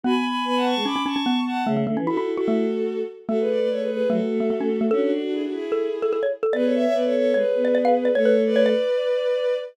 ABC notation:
X:1
M:4/4
L:1/16
Q:1/4=148
K:A
V:1 name="Violin"
[gb] [gb] [gb]2 [gb] [fa] [ac']2 [bd']2 [ac']4 [fa]2 | z4 [FA]3 [FA]7 z2 | [FA] [GB] [Bd] [Bd] [Ac] [GB] [GB]2 [FA]8 | [DF] [DF] [DF] [DF] [EG] [DF] [EG]8 z2 |
[GB] [Ac] [ce] [ce] [Bd] [Ac] [Ac]2 [GB]8 | [Ac]3 [Bd]11 z2 |]
V:2 name="Xylophone"
B,8 C C C C B,4 | A, A, A, C E E z F A,6 z2 | A,8 A,3 A, A, C z A, | A8 A3 A A c z A |
d8 c3 d d ^e z d | c B z2 c d9 z2 |]
V:3 name="Choir Aahs"
F z3 B,3 G, z8 | C,2 D, E, E6 z6 | A,4 A,4 F, z A,6 | C2 D4 E4 z6 |
B,4 B,4 G, z B,6 | A,6 z10 |]